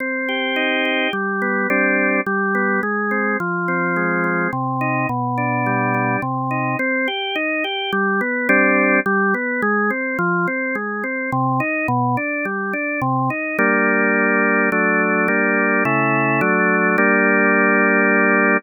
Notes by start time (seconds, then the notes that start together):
0.00 C4
0.29 G4
0.56 D#4
0.85 G4
1.13 G3
1.42 B3
1.70 G3 C4 D4
2.26 G3
2.55 B3
2.83 G#3
3.11 C4
3.40 F3
3.68 C4
3.96 G#3
4.24 C4
4.53 C3
4.81 D#4
5.09 B2
5.38 D4
5.66 G3
5.94 D4
6.22 C3
6.51 D#4
6.79 C4
7.08 G4
7.35 D#4
7.64 G4
7.92 G3
8.21 B3
8.49 G3 C4 D4
9.06 G3
9.34 B3
9.62 G#3
9.90 C4
10.19 F3
10.48 C4
10.75 G#3
11.04 C4
11.32 C3
11.60 D#4
11.88 B2
12.17 D4
12.45 G3
12.73 D4
13.02 C3
13.30 D#4
13.58 G3 A#3 D4
14.72 F#3 A3 D4
15.28 G3 A#3 D4
15.85 C#3 A3 E4
16.41 F#3 A3 D4
16.98 G3 A#3 D4